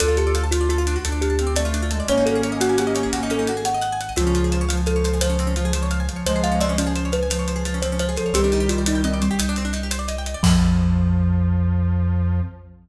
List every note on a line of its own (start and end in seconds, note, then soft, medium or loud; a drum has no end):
0.00 0.97 D2 loud
0.00 0.08 D4 loud
0.00 0.43 F4 medium
0.00 0.43 A4 medium
0.00 0.16 A4 medium
0.00 closed hi-hat loud
0.08 0.16 F4 medium
0.17 0.34 G4 medium
0.17 0.26 A4 medium
0.17 closed hi-hat medium
0.27 0.35 D5 medium
0.35 0.43 F5 loud
0.35 closed hi-hat medium
0.44 0.51 A5 medium
0.51 0.68 F4 medium
0.51 0.96 F4 medium
0.51 0.60 F5 medium
0.51 closed hi-hat medium
0.61 0.69 D5 medium
0.69 1.00 F4 medium
0.69 0.78 A4 loud
0.69 closed hi-hat medium
0.78 0.86 F4 medium
0.87 0.95 D4 loud
0.87 closed hi-hat medium
0.96 1.04 F#4 medium
1.05 2.01 D2 loud
1.05 1.33 D4 medium
1.05 1.12 A4 medium
1.05 closed hi-hat medium
1.12 1.20 D5 medium
1.21 1.53 G4 medium
1.21 1.30 F5 medium
1.21 closed hi-hat medium
1.30 1.38 A5 medium
1.39 1.53 C4 loud
1.39 1.47 F5 medium
1.39 closed hi-hat medium
1.47 1.55 D5 medium
1.56 1.85 A3 loud
1.56 1.63 A4 medium
1.56 2.04 D5 medium
1.56 closed hi-hat loud
1.65 1.73 F4 loud
1.74 1.82 D4 loud
1.74 closed hi-hat medium
1.82 1.90 F4 medium
1.91 2.07 G#3 medium
1.91 1.99 A4 medium
1.91 closed hi-hat medium
2.00 2.08 D5 medium
2.08 3.05 G#1 loud
2.08 3.50 A#3 loud
2.08 2.16 C#4 loud
2.08 3.50 C#4 loud
2.08 2.25 C#5 medium
2.08 closed hi-hat medium
2.17 2.25 D#4 medium
2.26 2.34 F#4 medium
2.26 2.41 A4 medium
2.26 closed hi-hat medium
2.35 2.43 G#4 medium
2.43 2.51 C#5 loud
2.43 closed hi-hat medium
2.52 2.60 D#5 medium
2.61 2.78 F#4 medium
2.61 2.68 F#5 medium
2.61 closed hi-hat medium
2.69 2.77 G#5 medium
2.78 3.09 G4 medium
2.78 2.86 F#5 medium
2.78 closed hi-hat medium
2.87 2.95 D#5 medium
2.95 3.02 C#5 medium
2.95 closed hi-hat medium
3.03 3.11 G#4 medium
3.13 4.09 G#1 medium
3.13 3.21 F#4 loud
3.13 closed hi-hat medium
3.23 3.31 D#4 medium
3.30 3.38 C#4 loud
3.30 3.65 A4 medium
3.30 closed hi-hat medium
3.39 3.47 D#4 loud
3.47 3.57 F#4 medium
3.47 closed hi-hat medium
3.57 3.65 G#4 medium
3.65 3.73 C#5 medium
3.65 4.12 F#5 medium
3.65 closed hi-hat medium
3.74 3.82 D#5 loud
3.81 3.89 F#5 loud
3.81 closed hi-hat medium
3.92 4.00 G#5 loud
4.01 4.08 F#5 medium
4.01 closed hi-hat medium
4.09 4.17 D#5 medium
4.16 6.09 C#2 loud
4.16 4.62 C#3 loud
4.16 4.62 F3 loud
4.16 4.24 C4 loud
4.16 4.81 F4 medium
4.16 closed hi-hat medium
4.27 4.35 C#4 medium
4.35 4.43 F4 loud
4.35 closed hi-hat medium
4.44 4.52 G#4 medium
4.52 4.60 C5 medium
4.52 closed hi-hat medium
4.61 4.69 C#5 loud
4.69 5.20 F3 medium
4.69 4.76 F5 medium
4.69 closed hi-hat medium
4.77 4.85 G#5 medium
4.86 5.19 A4 medium
4.86 4.94 F5 loud
4.86 closed hi-hat medium
4.96 5.04 C#5 medium
5.04 5.12 C5 loud
5.04 closed hi-hat medium
5.13 5.21 G#4 medium
5.21 5.53 F3 medium
5.21 5.30 F4 loud
5.21 5.83 C5 medium
5.21 closed hi-hat loud
5.30 5.37 C#4 medium
5.39 5.47 C4 medium
5.39 closed hi-hat medium
5.47 5.55 C#4 medium
5.56 5.71 F3 loud
5.56 5.65 F4 medium
5.56 closed hi-hat medium
5.65 5.73 G#4 medium
5.73 6.02 F3 medium
5.73 5.83 C5 medium
5.73 closed hi-hat medium
5.83 5.90 C#5 medium
5.91 5.99 F5 loud
5.91 closed hi-hat medium
6.00 6.08 G#5 medium
6.09 6.25 F3 medium
6.09 6.16 F5 medium
6.09 closed hi-hat medium
6.16 6.24 C#5 medium
6.26 8.18 C#2 medium
6.26 6.76 F3 loud
6.26 6.76 G#3 loud
6.26 6.34 C5 medium
6.26 6.41 C5 medium
6.26 closed hi-hat medium
6.36 6.43 G#4 medium
6.44 6.52 F4 loud
6.44 6.59 F5 medium
6.44 closed hi-hat medium
6.52 6.59 C#4 medium
6.60 6.68 C4 loud
6.60 6.76 D5 medium
6.60 closed hi-hat medium
6.69 6.77 C#4 medium
6.77 7.22 F3 medium
6.77 7.10 C#4 medium
6.77 6.87 F4 medium
6.77 closed hi-hat medium
6.86 6.94 G#4 medium
6.96 7.04 C5 loud
6.96 closed hi-hat medium
7.05 7.13 C#5 medium
7.12 7.81 B4 medium
7.12 7.20 F5 medium
7.12 closed hi-hat medium
7.23 7.30 G#5 medium
7.30 7.63 F3 medium
7.30 7.38 F5 medium
7.30 closed hi-hat loud
7.39 7.47 C#5 medium
7.48 7.56 C5 loud
7.48 closed hi-hat medium
7.56 7.64 G#4 medium
7.65 7.80 F3 medium
7.65 7.74 F4 medium
7.65 closed hi-hat medium
7.74 7.82 C#4 medium
7.82 8.12 F3 medium
7.82 7.91 C4 medium
7.82 7.97 C5 medium
7.82 closed hi-hat medium
7.92 8.00 C#4 medium
7.99 8.08 F4 loud
7.99 8.16 C5 medium
7.99 closed hi-hat medium
8.09 8.17 G#4 medium
8.16 8.31 F3 medium
8.16 8.33 A4 medium
8.16 8.24 C5 medium
8.16 closed hi-hat medium
8.26 8.34 C#5 medium
8.33 9.29 C2 loud
8.33 9.19 D#3 medium
8.33 9.19 G3 loud
8.33 8.42 C4 loud
8.33 8.67 G4 medium
8.33 closed hi-hat loud
8.44 8.52 D4 medium
8.52 8.61 D#4 loud
8.52 closed hi-hat medium
8.60 8.68 G4 medium
8.69 8.83 F4 medium
8.69 8.79 C5 medium
8.69 closed hi-hat medium
8.78 8.86 D5 medium
8.86 9.03 D#4 medium
8.86 8.95 D#5 medium
8.86 closed hi-hat loud
8.95 9.03 G5 medium
9.04 9.19 C4 medium
9.04 9.13 D#5 loud
9.04 closed hi-hat medium
9.14 9.21 D5 medium
9.22 10.16 G3 medium
9.22 9.29 C5 medium
9.22 closed hi-hat medium
9.31 9.38 G4 loud
9.39 10.35 C2 medium
9.39 9.47 D#4 loud
9.39 closed hi-hat loud
9.49 9.57 D4 loud
9.56 9.65 C4 medium
9.56 closed hi-hat medium
9.65 9.73 D4 loud
9.73 9.81 D#4 medium
9.73 closed hi-hat medium
9.83 9.91 G4 medium
9.91 9.99 C5 medium
9.91 closed hi-hat medium
9.99 10.07 D5 medium
10.08 10.16 D#5 loud
10.08 closed hi-hat medium
10.18 10.26 G5 medium
10.26 10.35 D#5 medium
10.26 closed hi-hat medium
10.34 10.42 D5 loud
10.43 12.41 F2 loud
10.43 12.39 F3 loud
10.43 12.40 F3 loud
10.43 12.40 F4 loud
10.43 12.40 A4 medium
10.43 kick loud
10.43 crash loud
10.50 12.40 C4 medium